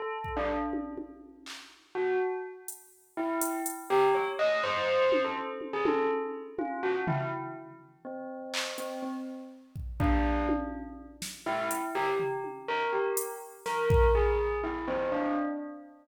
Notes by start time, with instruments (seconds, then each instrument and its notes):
0.00 tubular bells A4
0.24 kick
0.37 tubular bells D4
0.73 high tom
0.98 high tom
1.46 clap
1.95 tubular bells F#4
2.68 closed hi-hat
3.17 tubular bells E4
3.41 closed hi-hat
3.66 closed hi-hat
3.90 tubular bells G4
4.15 tubular bells C#5
4.39 tubular bells D#5
4.63 tubular bells C5
5.12 high tom
5.24 tubular bells A4
5.61 high tom
5.73 tubular bells G#4
5.85 tubular bells A4, high tom
6.59 tubular bells F4, high tom
6.83 tubular bells F#4
7.07 tubular bells E4, floor tom
8.05 tubular bells C4
8.54 clap
8.78 tubular bells C4, closed hi-hat
9.02 tubular bells C4
9.76 kick
10.00 tubular bells D4, kick
10.49 high tom
11.22 snare
11.46 tubular bells E4
11.71 closed hi-hat
11.95 tubular bells G4
12.20 floor tom
12.44 high tom
12.68 tubular bells A#4
12.93 tubular bells G4
13.17 closed hi-hat
13.66 tubular bells A#4, snare
13.90 kick
14.15 tubular bells G#4
14.64 tubular bells E4
14.88 tubular bells C4
15.12 tubular bells D4